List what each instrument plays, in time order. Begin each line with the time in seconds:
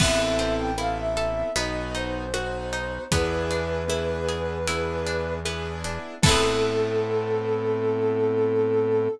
0.00 synth bass 1 A1, pizzicato strings B3, acoustic grand piano B3 C4 E4 A4, ocarina E5, kick, crash
0.39 pizzicato strings C4, closed hi-hat
0.58 ocarina G5
0.78 acoustic grand piano B3 C4 E4 A4, pizzicato strings E4, ocarina F5, cross-stick
0.97 ocarina E5
1.17 pizzicato strings A4, closed hi-hat
1.56 synth bass 1 B1, pizzicato strings B3, acoustic grand piano B3 D#4 F#4, ocarina D#5, closed hi-hat
1.95 pizzicato strings D#4, ocarina C5, closed hi-hat
2.34 acoustic grand piano B3 D#4 F#4, pizzicato strings F#4, cross-stick
2.73 pizzicato strings D#4, closed hi-hat
3.12 synth bass 1 E2, pizzicato strings B3, acoustic grand piano B3 D4 E4 G#4, ocarina B4, kick, closed hi-hat
3.51 pizzicato strings D4, closed hi-hat
3.88 acoustic grand piano B3 D4 E4 G#4, pizzicato strings E4, cross-stick
4.29 pizzicato strings G#4, closed hi-hat
4.68 acoustic grand piano B3 D4 E4 G#4, pizzicato strings E4, closed hi-hat
5.06 pizzicato strings D4, closed hi-hat
5.45 acoustic grand piano B3 D4 E4 G#4, pizzicato strings B3, cross-stick
5.84 pizzicato strings D4, closed hi-hat
6.22 synth bass 1 A2, acoustic grand piano B3 C4 E4 A4, pizzicato strings E4 A4, ocarina A4, kick, crash
6.29 pizzicato strings B3 C4